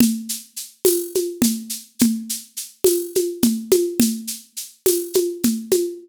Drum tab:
TB |---x---|---x---|---x---|
SH |xxxxxxx|xxxxxxx|xxxxxxx|
CG |O--ooO-|O--ooOo|O--ooOo|